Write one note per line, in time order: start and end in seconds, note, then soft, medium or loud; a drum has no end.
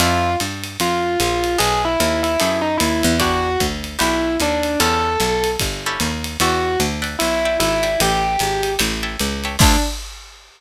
0.00 0.36 F2 loud
0.00 0.31 C4 loud
0.00 0.31 E4 loud
0.00 0.33 F4 medium
0.00 0.31 F4 loud
0.00 0.31 A4 medium
0.00 ride loud
0.40 0.77 G2 medium
0.40 hi-hat pedal medium
0.40 ride medium
0.64 ride medium
0.80 1.17 F2 medium
0.80 1.19 F4 medium
0.80 ride medium
1.20 1.57 A#1 medium
1.20 1.57 F4 medium
1.20 hi-hat pedal medium
1.20 ride medium
1.44 ride medium
1.58 1.97 B1 loud
1.58 1.89 B3 loud
1.58 1.89 D#4 loud
1.58 1.89 G#4 medium
1.58 1.79 G#4 medium
1.58 1.89 A4 loud
1.58 ride loud
1.85 2.22 E4 medium
2.00 2.37 D#2 loud
2.00 hi-hat pedal medium
2.00 ride medium
2.23 2.57 E4 medium
2.23 ride medium
2.40 2.78 F#2 medium
2.40 2.70 B3 medium
2.40 2.70 D#4 medium
2.40 2.70 G#4 medium
2.40 2.70 A4 medium
2.40 ride medium
2.62 2.76 D#4 medium
2.78 3.03 D#2 medium
2.78 3.13 E4 medium
2.78 hi-hat pedal medium
2.78 ride medium
3.03 3.57 E2 loud
3.03 ride medium
3.20 3.50 D4 loud
3.20 3.50 E4 medium
3.20 3.50 F#4 loud
3.20 3.58 F#4 loud
3.20 3.50 G4 loud
3.20 kick soft
3.20 ride medium
3.60 3.97 D2 medium
3.60 kick medium
3.60 hi-hat pedal medium
3.60 ride medium
3.84 ride medium
3.99 4.38 B1 medium
3.99 4.29 D4 medium
3.99 4.29 E4 medium
3.99 4.35 E4 medium
3.99 4.29 F#4 medium
3.99 4.29 G4 medium
3.99 ride medium
4.40 4.77 D#2 medium
4.40 4.81 D4 medium
4.40 hi-hat pedal medium
4.40 ride medium
4.63 ride medium
4.80 5.17 E2 loud
4.80 5.10 C#4 loud
4.80 5.10 E4 loud
4.80 5.10 G4 medium
4.80 5.10 A4 loud
4.80 5.48 A4 medium
4.80 ride medium
5.20 5.57 B1 medium
5.20 hi-hat pedal medium
5.20 ride medium
5.44 ride medium
5.60 5.97 G1 medium
5.60 kick medium
5.60 ride medium
5.86 6.12 C#4 loud
5.86 6.12 E4 medium
5.86 6.12 G4 medium
5.86 6.12 A4 loud
6.00 6.37 D#2 medium
6.00 hi-hat pedal medium
6.00 ride medium
6.24 ride medium
6.40 6.77 E2 loud
6.40 6.78 F#4 medium
6.40 6.72 D5 loud
6.40 6.72 E5 loud
6.40 6.72 F#5 medium
6.40 6.72 G5 loud
6.40 ride medium
6.80 7.16 D2 medium
6.80 hi-hat pedal medium
6.80 ride medium
7.02 7.28 D5 medium
7.02 7.28 E5 medium
7.02 7.28 F#5 medium
7.02 7.28 G5 medium
7.02 ride medium
7.19 7.58 B1 medium
7.19 7.56 E4 medium
7.19 ride loud
7.45 7.71 D5 medium
7.45 7.71 E5 medium
7.45 7.71 F#5 medium
7.45 7.71 G5 loud
7.60 7.97 G#1 medium
7.60 7.98 E4 medium
7.60 hi-hat pedal medium
7.60 ride medium
7.83 8.29 D5 medium
7.83 8.29 E5 medium
7.83 8.29 G5 medium
7.83 8.29 A5 loud
7.83 ride medium
8.00 8.37 A1 loud
8.00 8.70 G4 medium
8.00 ride loud
8.39 8.77 G#1 medium
8.39 hi-hat pedal medium
8.39 ride medium
8.63 ride medium
8.79 9.17 A1 loud
8.79 8.95 C#5 medium
8.79 8.95 E5 loud
8.79 8.95 G5 loud
8.79 8.95 A5 loud
8.79 ride medium
9.03 9.29 C#5 medium
9.03 9.29 E5 medium
9.03 9.29 G5 medium
9.03 9.29 A5 medium
9.20 9.57 C#2 medium
9.20 hi-hat pedal medium
9.20 ride medium
9.44 9.56 C#5 medium
9.44 9.56 E5 medium
9.44 9.56 G5 medium
9.44 9.56 A5 medium
9.44 ride medium
9.59 9.77 D2 loud
9.59 9.76 C4 loud
9.59 9.76 D4 loud
9.59 9.78 D4 loud
9.59 9.76 E4 loud
9.59 9.76 F4 loud
9.59 kick loud
9.59 crash loud